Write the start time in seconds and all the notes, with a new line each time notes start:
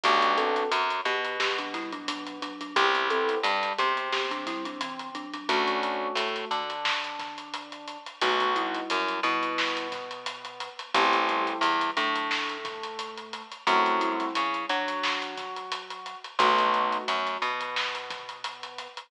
0.04 B1 A3 B3 D4 F#4 G4, kick, closed hi-hat
0.22 closed hi-hat
0.38 C4 A4, closed hi-hat
0.56 closed hi-hat
0.71 F#2 F#3, closed hi-hat
0.90 closed hi-hat
1.05 B2 B3 G4, closed hi-hat
1.25 closed hi-hat
1.40 B3 G4, snare
1.59 F#3 D4, closed hi-hat
1.74 G3 E4, kick, snare, closed hi-hat
1.92 F#3 D4, closed hi-hat
2.08 F#3 D4, closed hi-hat
2.27 closed hi-hat
2.42 F#3 D4, closed hi-hat
2.61 F#3 D4, closed hi-hat
2.76 C2 B3 C4 E4 G4, kick, closed hi-hat
2.95 closed hi-hat
3.10 C4 A4, closed hi-hat
3.29 closed hi-hat
3.43 G2 G3, closed hi-hat
3.63 closed hi-hat
3.78 C3 B3 C4 G4, closed hi-hat
3.97 closed hi-hat
4.12 B3 G4, snare
4.31 F#3 D4, snare, closed hi-hat
4.47 G3 E4, kick, snare, closed hi-hat
4.65 F#3 D4, closed hi-hat
4.81 E3 C4, closed hi-hat
4.99 closed hi-hat
5.15 F#3 D4, closed hi-hat
5.34 F#3 D4, closed hi-hat
5.49 D2 A3 C#4 D4 F#4, kick, closed hi-hat
5.67 closed hi-hat
5.83 closed hi-hat
6.15 A2 A3, closed hi-hat
6.36 closed hi-hat
6.51 D3 D4, closed hi-hat
6.70 closed hi-hat
6.85 snare
7.04 closed hi-hat
7.19 kick, snare, closed hi-hat
7.38 closed hi-hat
7.54 closed hi-hat
7.72 closed hi-hat
7.88 closed hi-hat
8.06 closed hi-hat
8.21 B1 A3 B3 D#4 F#4, kick, closed hi-hat
8.40 closed hi-hat
8.56 G3 E4, closed hi-hat
8.75 closed hi-hat
8.90 F#2 F#3, closed hi-hat
9.08 closed hi-hat
9.23 B2 G3 B3 E4, closed hi-hat
9.43 closed hi-hat
9.58 snare
9.77 closed hi-hat
9.92 kick, snare, closed hi-hat
10.11 closed hi-hat
10.26 closed hi-hat
10.45 closed hi-hat
10.60 closed hi-hat
10.79 closed hi-hat
10.94 A1 A3 B3 C4 E4 G4, kick, closed hi-hat
11.13 closed hi-hat
11.29 G3 E4, closed hi-hat
11.47 closed hi-hat
11.61 E2 E3, closed hi-hat
11.81 closed hi-hat
11.97 A2 F#3 A3 D4, closed hi-hat
12.16 closed hi-hat
12.31 snare
12.49 closed hi-hat
12.65 kick, snare, closed hi-hat
12.83 closed hi-hat
12.99 closed hi-hat
13.17 closed hi-hat
13.33 closed hi-hat
13.52 closed hi-hat
13.67 F#2 A3 C4 E4 F#4, kick, closed hi-hat
13.86 closed hi-hat
14.01 G3 E4, closed hi-hat
14.20 snare, closed hi-hat
14.35 C#3 C#4, closed hi-hat
14.54 closed hi-hat
14.69 F#3 D4 F#4, closed hi-hat
14.88 closed hi-hat
15.03 snare
15.22 closed hi-hat
15.37 kick, snare, closed hi-hat
15.56 closed hi-hat
15.72 closed hi-hat
15.90 closed hi-hat
16.06 closed hi-hat
16.24 closed hi-hat
16.39 B1 A3 B3 D#4 F#4, kick, closed hi-hat
16.59 closed hi-hat
16.74 closed hi-hat
16.92 closed hi-hat
17.08 F#2 F#3, closed hi-hat
17.27 snare, closed hi-hat
17.42 B2 B3, closed hi-hat
17.61 closed hi-hat
17.76 snare
17.95 closed hi-hat
18.10 kick, snare, closed hi-hat
18.29 closed hi-hat
18.44 closed hi-hat
18.63 closed hi-hat
18.78 closed hi-hat
18.97 closed hi-hat